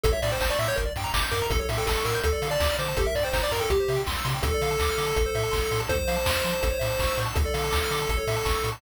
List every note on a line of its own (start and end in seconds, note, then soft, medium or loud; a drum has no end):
0.04 0.14 A1 loud
0.04 0.12 A4 medium
0.04 0.12 A4 loud
0.04 kick loud
0.04 closed hi-hat loud
0.12 0.20 C#5 medium
0.12 0.21 E5 medium
0.22 0.33 A2 medium
0.22 0.31 D5 medium
0.22 0.30 E5 medium
0.22 open hi-hat medium
0.31 0.40 C5 medium
0.31 0.39 G5 medium
0.41 0.51 A1 loud
0.41 0.50 C5 medium
0.41 0.50 A5 loud
0.41 kick medium
0.41 clap loud
0.50 0.59 D5 medium
0.50 0.59 C#6 medium
0.59 0.69 A2 medium
0.59 0.68 E5 medium
0.59 0.69 E6 medium
0.59 open hi-hat medium
0.68 0.77 C#5 medium
0.68 0.76 G6 loud
0.76 0.88 G1 loud
0.76 0.84 A#4 loud
0.76 kick medium
0.76 closed hi-hat medium
0.85 0.93 D5 medium
0.96 1.06 G2 medium
0.96 1.05 G5 medium
0.96 open hi-hat medium
1.04 1.12 A#5 medium
1.14 1.24 G1 medium
1.14 1.22 D6 loud
1.14 kick medium
1.14 clap loud
1.22 1.30 G6 medium
1.31 1.42 G2 loud
1.31 1.46 A#4 medium
1.31 1.40 D6 medium
1.31 open hi-hat medium
1.42 1.50 A#5 medium
1.50 1.60 A1 loud
1.50 1.58 A4 loud
1.50 1.60 A4 medium
1.50 kick loud
1.50 closed hi-hat medium
1.59 1.69 A4 medium
1.59 1.68 C#5 medium
1.69 1.79 A2 medium
1.69 1.78 E5 medium
1.69 open hi-hat medium
1.78 1.86 A4 medium
1.78 1.86 G5 medium
1.87 1.97 A1 medium
1.87 2.04 A4 medium
1.87 1.97 A5 medium
1.87 kick medium
1.87 clap loud
1.96 2.04 C#6 medium
2.05 2.15 A2 medium
2.05 2.20 A#4 medium
2.05 2.14 E6 medium
2.05 open hi-hat medium
2.14 2.23 G6 loud
2.23 2.34 D2 loud
2.23 2.48 A4 medium
2.23 2.33 A4 loud
2.23 kick medium
2.23 closed hi-hat loud
2.32 2.41 D5 medium
2.42 2.52 D3 loud
2.42 2.51 F5 medium
2.42 open hi-hat medium
2.51 2.77 D5 medium
2.51 2.59 A5 loud
2.60 2.70 D2 medium
2.60 2.70 D6 loud
2.60 kick medium
2.60 clap loud
2.70 2.78 F6 medium
2.78 2.89 D3 loud
2.78 2.97 C5 medium
2.78 2.87 D6 medium
2.78 open hi-hat medium
2.88 2.96 A5 loud
2.97 3.07 G1 loud
2.97 3.06 G4 loud
2.97 3.06 A4 medium
2.97 kick medium
2.97 closed hi-hat medium
3.05 3.14 A#4 medium
3.05 3.15 E5 medium
3.15 3.25 G2 medium
3.15 3.24 D5 medium
3.15 open hi-hat medium
3.23 3.33 C5 medium
3.23 3.31 G5 medium
3.33 3.43 G1 medium
3.33 3.42 C5 medium
3.33 3.42 A#5 medium
3.33 kick medium
3.33 clap loud
3.43 3.52 D5 medium
3.43 3.52 D6 medium
3.51 3.62 G2 medium
3.51 3.61 A#4 medium
3.51 3.59 A#5 medium
3.51 open hi-hat medium
3.60 3.70 A4 medium
3.60 3.68 G5 loud
3.70 3.80 C2 loud
3.70 4.02 G4 medium
3.70 3.79 G4 loud
3.70 kick medium
3.70 closed hi-hat loud
3.80 3.88 C5 medium
3.88 3.99 C3 medium
3.88 3.98 E5 medium
3.88 open hi-hat medium
3.96 4.04 G5 medium
4.07 4.17 C2 medium
4.07 4.15 C6 medium
4.07 kick medium
4.07 clap medium
4.18 4.26 E6 medium
4.24 4.35 C3 loud
4.24 4.33 C6 medium
4.24 open hi-hat medium
4.34 4.43 G5 medium
4.42 4.53 D2 loud
4.42 4.51 A4 loud
4.42 5.81 A4 medium
4.42 kick loud
4.42 closed hi-hat loud
4.54 4.62 D5 medium
4.61 4.71 D3 medium
4.61 4.70 F5 medium
4.61 open hi-hat medium
4.71 4.79 A5 medium
4.80 4.90 D2 medium
4.80 4.89 D6 loud
4.80 kick medium
4.80 clap medium
4.89 4.97 F6 loud
4.97 5.08 D3 medium
4.97 5.05 D6 medium
4.97 open hi-hat medium
5.06 5.14 A5 loud
5.16 5.26 A1 loud
5.16 5.24 A4 loud
5.16 kick medium
5.16 closed hi-hat loud
5.26 5.34 C5 loud
5.35 5.45 A2 loud
5.35 5.44 E5 loud
5.35 open hi-hat medium
5.43 5.52 A5 medium
5.51 5.63 A1 medium
5.51 5.59 C6 medium
5.51 kick medium
5.51 clap medium
5.62 5.70 E6 medium
5.71 5.81 A2 medium
5.71 5.80 C6 medium
5.71 open hi-hat medium
5.80 5.88 A5 medium
5.89 6.00 F2 loud
5.89 5.97 A4 loud
5.89 7.19 C5 medium
5.89 kick loud
5.89 closed hi-hat medium
5.99 6.07 C5 medium
6.08 6.18 F3 medium
6.08 6.16 F5 loud
6.08 open hi-hat medium
6.16 6.24 A5 loud
6.26 6.36 F2 medium
6.26 6.36 C6 loud
6.26 kick medium
6.26 clap loud
6.36 6.44 F6 medium
6.44 6.54 F3 medium
6.44 6.52 C6 medium
6.44 open hi-hat medium
6.53 6.61 A5 medium
6.63 6.73 A1 loud
6.63 6.71 A4 medium
6.63 kick medium
6.63 closed hi-hat loud
6.70 6.78 C#5 medium
6.79 6.91 A2 medium
6.79 6.88 E5 medium
6.79 open hi-hat medium
6.90 6.98 A5 medium
6.99 7.09 A1 medium
6.99 7.08 C#6 loud
6.99 kick medium
6.99 clap medium
7.07 7.16 E6 medium
7.17 7.28 A2 medium
7.17 7.25 C#6 medium
7.17 open hi-hat medium
7.26 7.34 A5 loud
7.35 7.46 D2 loud
7.35 8.70 A4 medium
7.35 7.45 A4 loud
7.35 kick loud
7.35 closed hi-hat medium
7.46 7.54 D5 medium
7.54 7.64 D3 medium
7.54 7.62 F5 medium
7.54 open hi-hat medium
7.64 7.72 A5 medium
7.71 7.82 D2 medium
7.71 7.79 D6 medium
7.71 kick medium
7.71 clap loud
7.83 7.92 F6 medium
7.91 8.01 D3 medium
7.91 7.99 D6 medium
7.91 open hi-hat medium
8.02 8.10 A5 medium
8.09 8.19 A1 loud
8.09 8.18 A4 loud
8.09 kick medium
8.09 closed hi-hat medium
8.17 8.25 C#5 medium
8.27 8.37 A2 medium
8.27 8.36 E5 medium
8.27 open hi-hat medium
8.36 8.45 A5 loud
8.45 8.56 A1 medium
8.45 8.54 C#6 loud
8.45 kick medium
8.45 clap medium
8.55 8.63 E6 medium
8.64 8.74 A2 medium
8.64 8.72 C#6 medium
8.64 open hi-hat medium
8.72 8.80 A5 medium